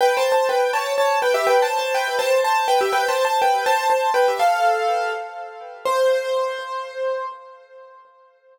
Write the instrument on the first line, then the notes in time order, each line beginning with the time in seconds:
acoustic grand piano
0.01 B4 G5
0.17 C5 A5
0.32 C5 A5
0.49 B4 G5
0.73 C#5 A5
0.98 C#5 A5
1.22 B4 G5
1.34 G4 E5
1.47 B4 G5
1.62 C5 A5
1.79 C5 A5
1.95 B4 G5
2.19 C5 A5
2.44 C5 A5
2.68 B4 G5
2.81 G4 E5
2.93 B4 G5
3.08 C5 A5
3.25 C5 A5
3.42 B4 G5
3.66 C5 A5
3.90 C5 A5
4.14 B4 G5
4.28 G4 E5
4.39 A4 F5
5.85 C5